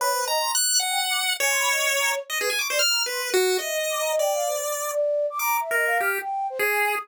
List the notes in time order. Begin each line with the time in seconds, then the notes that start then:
0.00 B4 C#5
0.13 C5
0.27 D#5 A#5
0.40 C6
0.55 F#6
0.80 F#5
0.90 G5
1.10 D6
1.40 C#5 G#5
1.50 C6
1.60 B5
1.70 D#5
1.90 C#5
2.00 A#5
2.10 C#5
2.30 D#5
2.40 G#4 B4
2.50 G#5
2.59 C#6 D6
2.70 C5 D5
2.79 F6
2.90 A#5
3.06 B4 C6
3.20 B4
3.34 F#4
3.59 D#5 E5
3.70 D#5
3.90 D6
4.00 A#5
4.10 D#5
4.19 D5 G5
4.33 F5
4.47 C5
4.90 D5
5.30 D6
5.39 A#5 D6
5.60 E5
5.71 A#4 D#5
5.86 F5
6.00 G4 F6
6.20 G5
6.50 C5
6.59 G#4
6.70 G#5
6.80 G#5
6.90 D#6